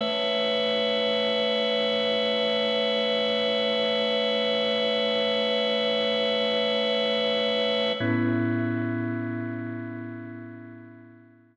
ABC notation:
X:1
M:4/4
L:1/8
Q:1/4=60
K:Amix
V:1 name="Drawbar Organ"
[A,Bce]8- | [A,Bce]8 | [A,,B,CE]8 |]